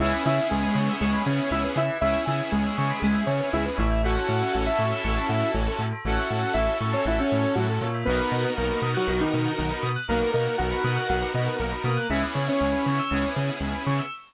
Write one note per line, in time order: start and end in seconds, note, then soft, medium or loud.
0.00 0.13 C#2 medium
0.00 1.81 B3 loud
0.00 1.81 C#4 loud
0.00 0.23 E4 medium
0.00 1.81 E4 medium
0.00 1.81 G#4 medium
0.00 0.12 G#4 loud
0.00 0.23 E5 medium
0.13 0.24 B4 loud
0.25 0.40 C#3 medium
0.25 0.48 E4 medium
0.25 0.36 C#5 medium
0.25 0.48 E5 medium
0.38 0.50 E5 medium
0.50 0.65 C#2 medium
0.50 0.93 G#3 medium
0.50 0.93 G#4 medium
0.50 0.62 G#5 medium
0.63 0.75 B5 medium
0.75 0.89 C#3 medium
0.75 0.87 C#6 medium
0.89 1.01 E6 medium
1.01 1.15 C#2 medium
1.01 1.22 G#3 medium
1.01 1.22 G#4 medium
1.01 1.13 C#6 medium
1.13 1.24 B5 medium
1.26 1.40 C#3 medium
1.26 1.50 C#4 medium
1.26 1.50 C#5 medium
1.26 1.38 G#5 medium
1.39 1.50 E5 medium
1.51 1.65 C#2 medium
1.51 1.63 E4 medium
1.51 1.63 C#5 medium
1.51 1.63 E5 medium
1.64 1.75 B4 medium
1.76 1.90 C#3 medium
1.76 1.98 E4 medium
1.76 1.88 G#4 medium
1.76 1.98 E5 medium
1.90 2.01 B4 medium
2.01 2.16 C#2 medium
2.01 3.83 B3 medium
2.01 3.83 C#4 medium
2.01 2.25 E4 medium
2.01 3.83 E4 medium
2.01 3.83 G#4 medium
2.01 2.13 C#5 loud
2.01 2.25 E5 medium
2.15 2.26 E5 medium
2.26 2.41 C#3 medium
2.26 2.51 E4 medium
2.26 2.51 E5 medium
2.26 2.37 G#5 medium
2.39 2.51 B5 medium
2.52 2.66 C#2 medium
2.52 2.99 G#3 medium
2.52 2.99 G#4 medium
2.52 2.63 C#6 medium
2.64 2.76 E6 medium
2.78 2.92 C#3 medium
2.78 2.89 C#6 medium
2.90 3.02 B5 medium
3.02 3.16 C#2 medium
3.02 3.23 G#3 medium
3.02 3.23 G#4 medium
3.02 3.14 G#5 loud
3.15 3.26 E5 medium
3.26 3.41 C#3 medium
3.26 3.49 C#4 medium
3.26 3.49 C#5 medium
3.26 3.39 C#5 medium
3.40 3.51 B4 medium
3.53 3.67 C#2 medium
3.53 3.65 E4 medium
3.53 3.65 G#4 loud
3.53 3.65 E5 medium
3.66 3.77 B4 medium
3.77 4.17 A1 medium
3.77 4.02 E4 medium
3.77 3.89 C#5 medium
3.77 4.02 E5 medium
3.90 4.02 E5 medium
4.03 5.85 C#4 loud
4.03 5.85 E4 medium
4.03 5.85 F#4 medium
4.03 4.15 F#4 loud
4.03 4.53 F#4 medium
4.03 5.85 A4 medium
4.03 4.53 F#5 medium
4.15 4.26 A4 medium
4.28 4.43 A2 medium
4.28 4.39 C#5 medium
4.42 4.53 E5 medium
4.53 4.69 A1 medium
4.53 4.65 F#4 medium
4.53 4.65 F#5 medium
4.53 4.65 F#5 loud
4.66 5.51 E4 medium
4.66 5.51 E5 medium
4.66 4.78 A5 medium
4.79 4.93 A2 medium
4.79 4.91 C#6 medium
4.92 5.04 E6 medium
5.04 5.18 A1 medium
5.04 5.16 C#6 loud
5.17 5.29 A5 medium
5.29 5.43 A2 medium
5.29 5.40 F#5 medium
5.41 5.52 E5 medium
5.54 5.68 A1 medium
5.54 5.66 C#5 medium
5.68 5.79 A4 medium
5.79 5.93 A2 medium
5.79 5.91 F#4 medium
5.93 6.04 A4 medium
6.05 6.19 A1 medium
6.05 7.87 C#4 medium
6.05 7.87 E4 medium
6.05 7.87 F#4 medium
6.05 6.53 F#4 medium
6.05 7.87 A4 medium
6.05 6.17 C#5 medium
6.05 6.53 F#5 medium
6.17 6.29 E5 medium
6.31 6.44 A2 medium
6.31 6.42 F#5 medium
6.44 6.55 A5 medium
6.54 6.69 A1 medium
6.54 6.77 E4 medium
6.54 6.77 E5 medium
6.54 6.67 C#6 loud
6.68 6.79 E6 medium
6.81 6.94 A2 medium
6.81 6.93 C#6 medium
6.92 7.05 C#4 medium
6.92 7.05 C#5 medium
6.92 7.04 A5 medium
7.05 7.19 A1 medium
7.05 7.19 E4 medium
7.05 7.19 E5 medium
7.05 7.18 F#5 medium
7.19 7.55 C#4 medium
7.19 7.55 C#5 medium
7.19 7.30 E5 medium
7.31 7.46 A2 medium
7.31 7.42 C#5 medium
7.43 7.54 A4 medium
7.55 7.79 A2 medium
7.55 7.67 F#3 medium
7.55 7.67 F#4 medium
7.55 7.68 F#4 medium
7.69 7.80 A4 medium
7.81 8.04 A#2 medium
7.81 7.93 C#5 medium
7.94 8.05 E5 medium
8.05 8.21 B1 medium
8.05 8.50 B3 medium
8.05 9.89 B3 medium
8.05 9.89 D#4 loud
8.05 9.89 F#4 medium
8.05 8.18 A#4 loud
8.05 9.89 A#4 loud
8.05 8.50 B4 medium
8.18 8.30 B4 medium
8.32 8.45 B2 medium
8.32 8.43 D#5 medium
8.45 8.56 F#5 medium
8.56 8.72 B1 medium
8.56 8.81 A#3 medium
8.56 8.81 A#4 medium
8.56 8.69 A#5 loud
8.70 8.81 B5 medium
8.82 8.96 B2 medium
8.82 8.94 D#6 medium
8.95 9.08 F#3 medium
8.95 9.08 F#4 medium
8.95 9.06 F#6 medium
9.08 9.22 B1 medium
9.08 9.21 F#3 medium
9.08 9.21 F#4 medium
9.08 9.19 A#4 loud
9.20 9.52 D#3 medium
9.20 9.52 D#4 medium
9.20 9.31 B4 medium
9.32 9.48 B2 medium
9.32 9.43 D#5 medium
9.45 9.57 F#5 medium
9.58 9.73 B1 medium
9.58 9.70 D#3 medium
9.58 9.70 D#4 medium
9.58 9.70 A#5 medium
9.71 9.82 B5 medium
9.83 9.97 B2 medium
9.83 9.94 D#6 medium
9.96 10.07 F#6 medium
10.08 10.23 B1 medium
10.08 10.30 A#3 medium
10.08 11.89 B3 medium
10.08 11.89 D#4 medium
10.08 11.89 F#4 medium
10.08 11.89 A#4 medium
10.08 10.30 A#4 medium
10.08 10.20 A#4 medium
10.21 10.33 B4 medium
10.33 10.48 B2 medium
10.33 10.56 A#3 medium
10.33 10.56 A#4 medium
10.33 10.46 D#5 medium
10.45 10.57 F#5 medium
10.58 10.74 B1 medium
10.58 11.07 F#4 medium
10.58 11.07 F#5 medium
10.58 10.70 A#5 loud
10.71 10.82 B5 loud
10.84 10.98 B2 medium
10.84 10.96 D#6 medium
10.96 11.08 F#6 medium
11.09 11.24 B1 medium
11.09 11.32 F#4 medium
11.09 11.20 A#4 medium
11.09 11.32 F#5 medium
11.22 11.33 B4 medium
11.33 11.48 B2 medium
11.33 11.56 B3 medium
11.33 11.56 B4 medium
11.33 11.46 D#5 medium
11.46 11.57 F#5 loud
11.59 11.74 B1 medium
11.59 11.72 A#3 medium
11.59 11.72 A#4 medium
11.59 11.70 A#5 medium
11.71 11.83 B5 medium
11.84 11.98 B2 medium
11.84 12.07 A#3 medium
11.84 12.07 A#4 medium
11.84 11.97 D#6 medium
11.97 12.09 F#6 medium
12.10 12.24 C#2 medium
12.10 13.01 B3 medium
12.10 13.01 C#4 medium
12.10 13.01 E4 medium
12.10 12.22 E4 medium
12.10 13.01 G#4 medium
12.10 12.21 G#4 loud
12.10 12.22 E5 medium
12.24 12.35 B4 loud
12.35 12.49 C#3 medium
12.35 12.46 C#5 medium
12.47 13.29 C#4 medium
12.47 13.29 C#5 medium
12.47 12.59 E5 medium
12.60 12.75 C#2 medium
12.60 12.72 G#5 medium
12.72 12.84 B5 medium
12.86 13.00 C#3 medium
12.86 12.97 C#6 medium
12.99 13.11 E6 loud
13.11 13.25 C#2 medium
13.11 14.02 B3 medium
13.11 14.02 C#4 medium
13.11 14.02 E4 medium
13.11 13.22 G#4 medium
13.11 14.02 G#4 medium
13.23 13.35 B4 medium
13.36 13.50 C#3 medium
13.36 13.47 C#5 medium
13.49 13.60 E5 medium
13.61 13.74 C#2 medium
13.61 13.73 G#5 medium
13.74 13.85 B5 medium
13.87 14.00 C#3 medium
13.87 13.98 C#6 medium
13.99 14.10 E6 medium